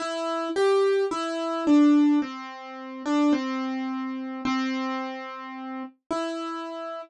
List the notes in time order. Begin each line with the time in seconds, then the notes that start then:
0.00 E4
0.56 G4
1.11 E4
1.67 D4
2.22 C4
3.06 D4
3.33 C4
4.45 C4
6.11 E4